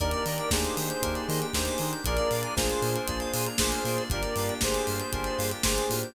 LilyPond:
<<
  \new Staff \with { instrumentName = "Lead 1 (square)" } { \time 4/4 \key ees \major \tempo 4 = 117 <bes' d''>4 <aes' c''>2 <aes' c''>4 | <bes' d''>4 <aes' c''>2 <aes' c''>4 | <bes' d''>4 <aes' c''>2 <aes' c''>4 | }
  \new Staff \with { instrumentName = "Lead 2 (sawtooth)" } { \time 4/4 \key ees \major <bes d' ees' g'>16 <bes d' ees' g'>16 <bes d' ees' g'>8 <bes d' ees' g'>4 <bes d' ees' g'>8 <bes d' ees' g'>16 <bes d' ees' g'>16 <bes d' ees' g'>8 <bes d' ees' g'>8 | <bes d' f' aes'>16 <bes d' f' aes'>16 <bes d' f' aes'>8 <bes d' f' aes'>4 <bes d' f' aes'>8 <bes d' f' aes'>16 <bes d' f' aes'>16 <bes d' f' aes'>8 <bes d' f' aes'>8 | <bes d' f' g'>16 <bes d' f' g'>16 <bes d' f' g'>8 <bes d' f' g'>4 <bes d' f' g'>8 <bes d' f' g'>16 <bes d' f' g'>16 <bes d' f' g'>8 <bes d' f' g'>8 | }
  \new Staff \with { instrumentName = "Electric Piano 2" } { \time 4/4 \key ees \major bes'16 d''16 ees''16 g''16 bes''16 d'''16 ees'''16 g'''16 bes'16 d''16 ees''16 g''16 bes''16 d'''16 ees'''16 g'''16 | bes'16 d''16 f''16 aes''16 bes''16 d'''16 f'''16 bes'16 d''16 f''16 aes''16 bes''16 d'''16 f'''16 bes'16 d''16 | bes'16 d''16 f''16 g''16 bes''16 d'''16 f'''16 g'''16 bes'16 d''16 f''16 g''16 bes''16 d'''16 f'''16 g'''16 | }
  \new Staff \with { instrumentName = "Synth Bass 2" } { \clef bass \time 4/4 \key ees \major ees,8 ees8 ees,8 ees8 ees,8 ees8 ees,8 ees8 | bes,,8 bes,8 bes,,8 bes,8 bes,,8 bes,8 bes,,8 bes,8 | g,,8 g,8 g,,8 g,8 g,,8 g,8 g,,8 a,8 | }
  \new Staff \with { instrumentName = "Pad 5 (bowed)" } { \time 4/4 \key ees \major <bes d' ees' g'>1 | <bes d' f' aes'>1 | <bes d' f' g'>1 | }
  \new DrumStaff \with { instrumentName = "Drums" } \drummode { \time 4/4 <hh bd>16 hh16 hho16 hh16 <bd sn>16 hh16 hho16 hh16 <hh bd>16 hh16 hho16 hh16 <bd sn>16 hh16 hho16 hh16 | <hh bd>16 hh16 hho16 hh16 <bd sn>16 hh16 hho16 hh16 <hh bd>16 hh16 hho16 hh16 <bd sn>16 hh16 hho16 hh16 | <hh bd>16 hh16 hho16 hh16 <bd sn>16 hh16 hho16 hh16 <hh bd>16 hh16 hho16 hh16 <bd sn>16 hh16 hho16 hh16 | }
>>